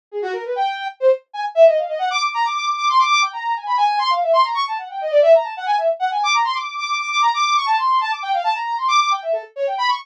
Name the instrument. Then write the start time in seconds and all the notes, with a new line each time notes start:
brass section
0.11 G#4
0.22 F#4
0.33 A#4
0.45 B4
0.56 G5
1.00 C5
1.33 G#5
1.55 E5
1.67 D#5
1.77 F5
1.88 D#5
1.99 F#5
2.10 D6
2.22 D6
2.34 A#5
2.45 D6
2.56 D6
2.67 D6
2.77 D6
2.89 C6
2.99 D6
3.10 D6
3.22 G5
3.33 A#5
3.56 G#5
3.66 B5
3.77 G#5
3.99 C6
4.10 F5
4.22 E5
4.33 C6
4.44 A#5
4.54 C#6
4.67 A5
4.78 F#5
4.90 G5
5.01 D#5
5.11 D5
5.22 E5
5.35 A#5
5.44 A5
5.57 F#5
5.66 G#5
5.78 E5
5.99 F#5
6.11 G#5
6.23 D6
6.34 A#5
6.45 C6
6.54 D6
6.78 D6
6.89 D6
7.01 D6
7.10 D6
7.22 A#5
7.34 D6
7.56 C#6
7.66 A5
7.78 C6
8.01 A5
8.11 D6
8.22 G5
8.33 F5
8.44 A5
8.55 A#5
8.78 C6
8.88 D6
9.00 D6
9.11 G5
9.22 E5
9.32 A4
9.56 C#5
9.67 G5
9.78 B5
9.88 C#6